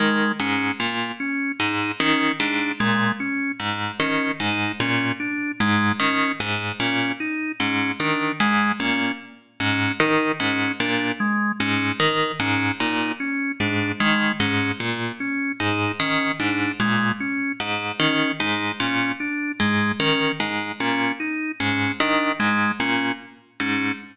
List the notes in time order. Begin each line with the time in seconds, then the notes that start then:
0.00 D#3 G#3
0.40 G#2 C#4
0.80 A#2
1.20 C#4
1.60 G#2 D#4
2.00 D#3 C#4
2.40 G#2 D4
2.80 A#2 G#3
3.20 C#4
3.60 G#2
4.00 D#3 C#4
4.40 G#2 D#4
4.80 A#2 C#4
5.20 D4
5.60 G#2 G#3
6.00 D#3 C#4
6.40 G#2
6.80 A#2 C#4
7.20 D#4
7.60 G#2 C#4
8.00 D#3 D4
8.40 G#2 G#3
8.80 A#2 C#4
9.60 G#2 C#4
10.00 D#3 D#4
10.40 G#2 C#4
10.80 A#2 D4
11.20 G#3
11.60 G#2 C#4
12.00 D#3
12.40 G#2 C#4
12.80 A#2 D#4
13.20 C#4
13.60 G#2 D4
14.00 D#3 G#3
14.40 G#2 C#4
14.80 A#2
15.20 C#4
15.60 G#2 D#4
16.00 D#3 C#4
16.40 G#2 D4
16.80 A#2 G#3
17.20 C#4
17.60 G#2
18.00 D#3 C#4
18.40 G#2 D#4
18.80 A#2 C#4
19.20 D4
19.60 G#2 G#3
20.00 D#3 C#4
20.40 G#2
20.80 A#2 C#4
21.20 D#4
21.60 G#2 C#4
22.00 D#3 D4
22.40 G#2 G#3
22.80 A#2 C#4
23.60 G#2 C#4